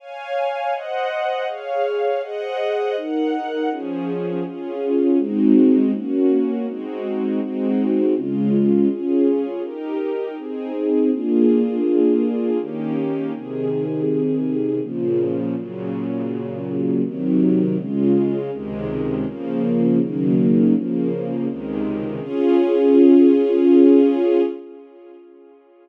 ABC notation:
X:1
M:3/4
L:1/8
Q:1/4=81
K:Db
V:1 name="String Ensemble 1"
[dfa]2 [ceg]2 [Adf]2 | [Aceg]2 [EBg]2 [F,DA]2 | [DFA]2 [A,CEG]2 [B,DG]2 | [A,CEG]2 [A,CEG]2 [D,A,F]2 |
[DFA]2 [E=GB]2 [CEA]2 | [B,=DFA]4 [E,B,_D=G]2 | [C,E,A]4 [B,,D,F,]2 | [B,,D,G,]4 [C,E,G,]2 |
[D,A,F]2 [D,,C,E,A,]2 [D,F,B,]2 | [D,E,G,B,]2 [D,F,B,]2 [D,,C,E,A,]2 | [DFA]6 |]